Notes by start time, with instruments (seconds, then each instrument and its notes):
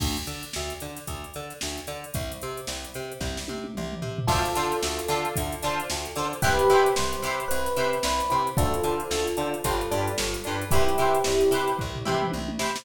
0.00 electric bass (finger) D2, kick, crash
0.17 closed hi-hat
0.27 electric bass (finger) D3, snare, closed hi-hat
0.43 closed hi-hat
0.53 electric bass (finger) D2, snare
0.70 closed hi-hat
0.80 electric bass (finger) D3, closed hi-hat
0.97 snare, closed hi-hat
1.07 electric bass (finger) D2, kick, closed hi-hat
1.24 closed hi-hat
1.34 electric bass (finger) D3, closed hi-hat
1.50 snare, closed hi-hat
1.61 electric bass (finger) D2, snare
1.77 snare, closed hi-hat
1.87 electric bass (finger) D3, snare, closed hi-hat
2.04 closed hi-hat
2.14 electric bass (finger) C2, kick, closed hi-hat
2.32 closed hi-hat
2.42 electric bass (finger) C3, closed hi-hat
2.57 closed hi-hat
2.67 electric bass (finger) C2, snare
2.84 closed hi-hat
2.94 electric bass (finger) C3, closed hi-hat
3.12 closed hi-hat
3.21 electric bass (finger) C2, kick, snare
3.37 snare
3.48 electric bass (finger) C3, high tom
3.64 high tom
3.75 electric bass (finger) C2, mid tom
3.92 mid tom
4.02 electric bass (finger) C3, floor tom
4.18 floor tom
4.27 electric bass (finger) D2, acoustic guitar (steel) D4 F4 A4, electric piano 1 F4 A4, kick, crash
4.32 acoustic guitar (steel) C5
4.45 snare, closed hi-hat
4.55 electric bass (finger) D3, acoustic guitar (steel) D4 F4 A4 C5, closed hi-hat
4.72 closed hi-hat
4.83 electric bass (finger) D2, snare
4.99 closed hi-hat
5.08 electric bass (finger) D3, acoustic guitar (steel) D4 F4 A4 C5, closed hi-hat
5.25 closed hi-hat
5.36 electric bass (finger) D2, kick, closed hi-hat
5.52 closed hi-hat
5.62 electric bass (finger) D3, acoustic guitar (steel) D4 F4 A4, closed hi-hat
5.67 acoustic guitar (steel) C5
5.80 closed hi-hat
5.90 electric bass (finger) D2, snare
6.05 closed hi-hat
6.16 electric bass (finger) D3, acoustic guitar (steel) D4 F4 A4 C5, closed hi-hat
6.33 closed hi-hat
6.42 electric bass (finger) C2, acoustic guitar (steel) E4 G4 B4, electric piano 1 G4 B4, kick, closed hi-hat
6.46 acoustic guitar (steel) C5
6.59 closed hi-hat
6.70 electric bass (finger) C3, acoustic guitar (steel) E4 G4 B4 C5, closed hi-hat
6.86 closed hi-hat
6.96 electric bass (finger) C2, electric piano 1 C5, snare
7.13 closed hi-hat
7.22 electric bass (finger) C3, acoustic guitar (steel) E4 G4 B4, closed hi-hat
7.27 acoustic guitar (steel) C5
7.40 closed hi-hat
7.48 electric bass (finger) C2, electric piano 1 B4, closed hi-hat
7.66 snare, closed hi-hat
7.76 electric bass (finger) C3, acoustic guitar (steel) E4 G4 B4 C5, closed hi-hat
7.93 closed hi-hat
8.03 electric bass (finger) C2, electric piano 1 B4, snare
8.20 closed hi-hat
8.30 electric bass (finger) C3, acoustic guitar (steel) E4 G4 B4 C5, closed hi-hat
8.47 closed hi-hat
8.57 electric bass (finger) D2, acoustic guitar (steel) D4 F4 A4 C5, electric piano 1 F4 A4, kick, closed hi-hat
8.74 closed hi-hat
8.83 electric bass (finger) D3, acoustic guitar (steel) D4 F4 A4 C5, closed hi-hat
9.00 closed hi-hat
9.11 electric bass (finger) D2, snare
9.27 closed hi-hat
9.37 electric bass (finger) D3, acoustic guitar (steel) D4 F4 A4, closed hi-hat
9.41 acoustic guitar (steel) C5
9.54 closed hi-hat
9.64 electric bass (finger) G1, acoustic guitar (steel) D4 F4 G4 B4, kick, closed hi-hat
9.81 closed hi-hat
9.91 electric bass (finger) G2, acoustic guitar (steel) D4 F4 G4 B4, closed hi-hat
10.07 closed hi-hat
10.18 electric bass (finger) G1, snare
10.34 closed hi-hat
10.44 electric bass (finger) G2, acoustic guitar (steel) D4 F4 G4, closed hi-hat
10.48 acoustic guitar (steel) B4
10.61 closed hi-hat
10.71 electric bass (finger) C2, electric piano 1 E4 G4, acoustic guitar (steel) E4 G4 B4, kick, closed hi-hat
10.75 acoustic guitar (steel) C5
10.89 closed hi-hat
10.98 electric bass (finger) C3, acoustic guitar (steel) E4 G4 B4 C5, closed hi-hat
11.15 closed hi-hat
11.24 electric bass (finger) C2, snare
11.41 closed hi-hat
11.51 electric bass (finger) C3, acoustic guitar (steel) E4 G4 B4, closed hi-hat
11.55 acoustic guitar (steel) C5
11.68 closed hi-hat
11.78 electric bass (finger) C2, kick, floor tom
11.95 floor tom
12.05 electric bass (finger) C3, acoustic guitar (steel) E4 G4 B4 C5, mid tom
12.22 mid tom
12.32 electric bass (finger) C2, high tom
12.48 high tom
12.59 electric bass (finger) C3, acoustic guitar (steel) E4 G4 B4 C5, snare
12.76 snare